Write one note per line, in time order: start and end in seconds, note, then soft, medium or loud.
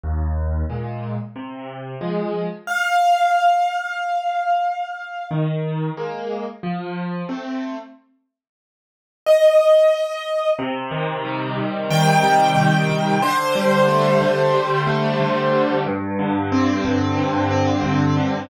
0.03 0.63 D#2 medium
0.70 1.16 A#2 medium
0.70 1.16 G#3 soft
1.36 1.95 C3 medium
2.01 2.47 F3 medium
2.01 2.47 G#3 medium
2.67 5.27 F5 medium
5.31 5.90 D#3 medium
5.97 6.43 G#3 medium
5.97 6.43 A#3 medium
6.63 7.22 F3 medium
7.29 7.75 A3 medium
7.29 7.75 C4 medium
9.26 10.49 D#5 medium
10.59 11.57 C3 loud
10.91 11.90 D#3 medium
11.25 12.23 G3 medium
11.57 12.55 C3 medium
11.90 12.88 D#3 loud
11.90 13.21 G5 medium
12.23 13.17 G3 medium
12.56 13.18 C3 medium
12.89 13.20 D#3 medium
13.22 14.20 D3 loud
13.22 15.75 C5 medium
13.55 14.54 G3 medium
13.88 14.86 A3 medium
14.21 15.19 D3 medium
14.54 15.52 G3 medium
14.87 15.81 A3 medium
15.20 15.83 D3 medium
15.53 15.84 G3 medium
15.86 16.84 G2 loud
16.19 17.17 D3 medium
16.52 17.50 C4 medium
16.84 17.83 G2 medium
17.17 18.16 D3 medium
17.51 18.45 C4 medium
17.84 18.46 G2 medium
18.17 18.48 D3 loud